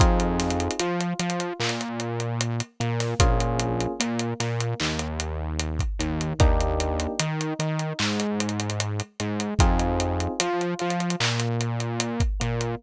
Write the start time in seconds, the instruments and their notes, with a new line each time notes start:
0.00 synth bass 1 F2, electric piano 1 C4 D#4 F4 G#4, kick, closed hi-hat
0.20 closed hi-hat
0.40 snare, closed hi-hat
0.51 closed hi-hat
0.60 closed hi-hat
0.71 closed hi-hat
0.80 synth bass 1 F3, electric piano 1 F4, closed hi-hat
1.01 closed hi-hat
1.19 synth bass 1 F3, electric piano 1 F4, closed hi-hat
1.30 closed hi-hat
1.40 closed hi-hat
1.60 synth bass 1 A#2, electric piano 1 A#3, clap
1.69 closed hi-hat
1.81 closed hi-hat
2.00 closed hi-hat
2.20 closed hi-hat
2.41 closed hi-hat
2.60 closed hi-hat
2.80 synth bass 1 A#2, electric piano 1 A#3, closed hi-hat
3.00 snare, closed hi-hat
3.19 synth bass 1 A#1, electric piano 1 A#3 C#4 F4 G#4, kick, closed hi-hat
3.40 closed hi-hat
3.60 closed hi-hat
3.81 closed hi-hat
4.00 synth bass 1 A#2, electric piano 1 A#3, closed hi-hat
4.19 closed hi-hat
4.40 synth bass 1 A#2, electric piano 1 A#3, snare, closed hi-hat
4.61 closed hi-hat
4.80 synth bass 1 D#2, electric piano 1 D#3, clap
4.99 closed hi-hat
5.20 closed hi-hat
5.60 closed hi-hat
5.79 kick, closed hi-hat
5.99 synth bass 1 D#2, electric piano 1 D#3, closed hi-hat
6.21 closed hi-hat
6.39 synth bass 1 D#2, electric piano 1 A#3 D4 D#4 G4, kick, closed hi-hat
6.61 closed hi-hat
6.80 closed hi-hat
7.00 closed hi-hat
7.20 synth bass 1 D#3, electric piano 1 D#4, closed hi-hat
7.41 closed hi-hat
7.59 synth bass 1 D#3, electric piano 1 D#4, closed hi-hat
7.79 closed hi-hat
7.99 synth bass 1 G#2, electric piano 1 G#3, clap
8.20 closed hi-hat
8.40 closed hi-hat
8.49 closed hi-hat
8.60 closed hi-hat
8.70 closed hi-hat
8.80 closed hi-hat
9.00 closed hi-hat
9.20 synth bass 1 G#2, electric piano 1 G#3, closed hi-hat
9.40 closed hi-hat
9.59 synth bass 1 F2, electric piano 1 C4 D#4 F4 G#4, kick, closed hi-hat
9.79 closed hi-hat
10.00 closed hi-hat
10.20 closed hi-hat
10.40 synth bass 1 F3, electric piano 1 F4, closed hi-hat
10.61 closed hi-hat
10.79 synth bass 1 F3, electric piano 1 F4, closed hi-hat
10.90 closed hi-hat
11.00 closed hi-hat
11.10 closed hi-hat
11.20 synth bass 1 A#2, electric piano 1 A#3, clap
11.40 closed hi-hat
11.61 closed hi-hat
11.80 closed hi-hat
12.00 closed hi-hat
12.20 kick, closed hi-hat
12.40 synth bass 1 A#2, electric piano 1 A#3, closed hi-hat
12.61 closed hi-hat